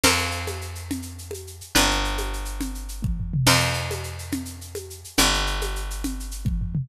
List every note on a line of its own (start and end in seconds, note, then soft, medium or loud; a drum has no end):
0.04 1.61 F2 medium
0.04 1.72 A#4 medium
0.04 1.72 C5 medium
0.04 1.72 F5 medium
0.04 crash loud
0.04 low conga loud
0.04 shaker medium
0.18 shaker medium
0.31 shaker medium
0.47 high conga medium
0.47 shaker medium
0.61 shaker medium
0.75 shaker medium
0.91 low conga loud
0.91 shaker medium
1.02 shaker medium
1.18 shaker medium
1.31 high conga medium
1.31 shaker medium
1.47 shaker medium
1.61 shaker medium
1.75 3.33 G1 medium
1.75 3.43 B4 medium
1.75 3.43 D5 medium
1.75 3.43 G5 medium
1.75 low conga loud
1.75 shaker medium
1.91 shaker medium
2.04 shaker medium
2.18 high conga medium
2.18 shaker medium
2.33 shaker medium
2.45 shaker medium
2.61 low conga loud
2.61 shaker medium
2.75 shaker medium
2.89 shaker medium
3.02 kick loud
3.02 high tom medium
3.20 floor tom medium
3.34 mid tom loud
3.46 5.04 F2 loud
3.46 5.15 A#4 medium
3.46 5.15 C5 medium
3.46 5.15 F5 medium
3.46 crash loud
3.46 low conga loud
3.46 shaker medium
3.60 shaker medium
3.74 shaker medium
3.91 high conga loud
3.91 shaker medium
4.04 shaker medium
4.19 shaker medium
4.32 low conga loud
4.32 shaker medium
4.45 shaker medium
4.61 shaker medium
4.75 high conga loud
4.75 shaker medium
4.90 shaker medium
5.04 shaker medium
5.17 6.76 G1 medium
5.17 6.86 B4 medium
5.17 6.86 D5 medium
5.17 6.86 G5 medium
5.17 low conga loud
5.17 shaker medium
5.34 shaker medium
5.47 shaker medium
5.61 high conga medium
5.61 shaker medium
5.76 shaker medium
5.90 shaker medium
6.04 low conga loud
6.04 shaker medium
6.20 shaker medium
6.31 shaker medium
6.45 kick loud
6.45 high tom medium
6.61 floor tom loud
6.75 mid tom loud